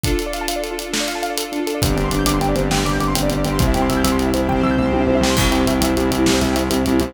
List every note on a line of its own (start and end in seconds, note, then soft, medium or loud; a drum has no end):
0.04 1.80 D4 medium
0.04 0.11 D4 medium
0.04 1.80 F4 medium
0.04 1.80 A4 medium
0.04 kick medium
0.04 closed hi-hat medium
0.12 0.18 F4 medium
0.19 0.26 A4 medium
0.19 closed hi-hat medium
0.26 0.33 D5 medium
0.33 0.40 F5 medium
0.33 closed hi-hat medium
0.41 0.48 A5 medium
0.48 0.55 F5 medium
0.48 closed hi-hat medium
0.56 0.63 D5 medium
0.63 0.70 A4 medium
0.63 closed hi-hat medium
0.71 0.77 F4 medium
0.78 0.85 D4 medium
0.78 closed hi-hat medium
0.86 0.92 F4 medium
0.93 1.00 A4 medium
0.93 snare loud
1.00 1.07 D5 medium
1.08 1.14 F5 medium
1.08 closed hi-hat medium
1.15 1.22 A5 medium
1.23 1.29 F5 medium
1.23 closed hi-hat medium
1.30 1.37 D5 medium
1.38 1.44 A4 medium
1.38 closed hi-hat loud
1.45 1.51 F4 medium
1.52 1.59 D4 medium
1.52 closed hi-hat medium
1.60 1.66 F4 medium
1.67 1.74 A4 medium
1.67 closed hi-hat medium
1.75 1.81 D5 medium
1.82 1.94 G1 loud
1.82 2.70 C4 medium
1.82 2.70 D4 medium
1.82 2.70 G4 medium
1.82 1.88 C5 medium
1.82 kick loud
1.82 closed hi-hat loud
1.89 1.96 D5 medium
1.96 2.09 G1 medium
1.96 2.03 G5 medium
1.96 closed hi-hat medium
2.04 2.11 C6 medium
2.11 2.24 G1 medium
2.11 2.18 D6 medium
2.11 closed hi-hat medium
2.19 2.26 G6 medium
2.26 2.38 G1 loud
2.26 2.33 D6 medium
2.26 closed hi-hat loud
2.34 2.40 C6 medium
2.39 2.52 G1 medium
2.39 2.48 G5 medium
2.39 closed hi-hat medium
2.49 2.55 D5 medium
2.56 2.68 G1 medium
2.56 2.63 C5 medium
2.56 closed hi-hat medium
2.63 2.70 D5 medium
2.71 2.83 G1 medium
2.71 3.59 G3 medium
2.71 3.59 C4 medium
2.71 3.59 G4 medium
2.71 2.78 G5 medium
2.71 snare medium
2.78 2.85 C6 medium
2.85 2.97 G1 medium
2.85 2.92 D6 medium
2.85 closed hi-hat medium
2.93 3.00 G6 medium
2.99 3.12 G1 medium
2.99 3.07 D6 medium
2.99 closed hi-hat medium
3.08 3.15 C6 medium
3.15 3.29 G1 medium
3.15 3.22 G5 medium
3.15 closed hi-hat loud
3.23 3.29 D5 medium
3.30 3.44 G1 medium
3.30 3.37 C5 medium
3.30 closed hi-hat medium
3.37 3.44 D5 medium
3.45 3.58 G1 medium
3.45 3.52 G5 medium
3.45 closed hi-hat medium
3.52 3.59 C6 medium
3.59 3.73 C2 loud
3.59 4.48 C4 medium
3.59 4.48 E4 medium
3.59 4.48 G4 medium
3.59 3.66 C5 medium
3.59 kick loud
3.59 closed hi-hat medium
3.67 3.74 E5 medium
3.74 3.88 C2 medium
3.74 3.81 G5 medium
3.74 closed hi-hat medium
3.82 3.89 C6 medium
3.89 4.02 C2 loud
3.89 3.96 E6 medium
3.89 closed hi-hat medium
3.97 4.03 G6 medium
4.04 4.17 C2 medium
4.04 4.11 E6 medium
4.04 closed hi-hat medium
4.12 4.18 C6 medium
4.18 4.30 C2 medium
4.18 4.26 G5 medium
4.18 closed hi-hat medium
4.26 4.33 E5 medium
4.34 4.47 C2 medium
4.34 4.40 C5 medium
4.34 closed hi-hat medium
4.41 4.48 E5 medium
4.48 4.61 C2 medium
4.48 5.36 C4 medium
4.48 5.36 G4 medium
4.48 5.36 C5 medium
4.48 4.55 G5 medium
4.48 kick medium
4.48 floor tom medium
4.56 4.63 C6 medium
4.63 4.75 C2 loud
4.63 4.70 E6 medium
4.63 floor tom medium
4.71 4.78 G6 medium
4.78 4.91 C2 medium
4.78 4.85 E6 medium
4.78 mid tom medium
4.86 4.92 C6 medium
4.92 5.05 C2 medium
4.92 5.00 G5 medium
4.92 high tom medium
5.00 5.07 E5 medium
5.07 5.19 C2 medium
5.07 5.15 C5 medium
5.07 high tom medium
5.15 5.22 E5 medium
5.21 5.33 C2 loud
5.21 5.30 G5 medium
5.21 snare medium
5.30 5.37 C6 medium
5.37 5.50 C2 loud
5.37 5.44 C4 medium
5.37 7.14 C4 medium
5.37 7.14 E4 medium
5.37 7.14 G4 medium
5.37 kick loud
5.37 crash loud
5.45 5.52 E4 medium
5.51 5.64 C2 medium
5.51 5.59 G4 medium
5.51 closed hi-hat medium
5.60 5.66 C5 medium
5.67 5.79 C2 medium
5.67 5.74 E5 medium
5.67 closed hi-hat medium
5.74 5.81 G5 medium
5.81 5.94 C2 loud
5.81 5.89 E5 medium
5.81 closed hi-hat medium
5.89 5.96 C5 medium
5.97 6.10 C2 loud
5.97 6.03 G4 medium
5.97 closed hi-hat medium
6.04 6.11 E4 medium
6.11 6.24 C2 loud
6.11 6.18 C4 medium
6.11 closed hi-hat medium
6.19 6.26 E4 medium
6.26 6.40 C2 loud
6.26 6.33 G4 medium
6.26 snare loud
6.34 6.40 C5 medium
6.41 6.54 C2 loud
6.41 6.48 E5 medium
6.41 closed hi-hat medium
6.49 6.55 G5 medium
6.56 6.68 C2 medium
6.56 6.63 E5 medium
6.56 closed hi-hat medium
6.63 6.70 C5 medium
6.70 6.82 C2 medium
6.70 6.77 G4 medium
6.70 closed hi-hat medium
6.78 6.85 E4 medium
6.86 7.00 C2 loud
6.86 6.92 C4 medium
6.86 closed hi-hat medium
6.93 7.00 E4 medium
7.00 7.14 C2 loud
7.00 7.07 G4 medium
7.00 closed hi-hat medium
7.08 7.14 C5 medium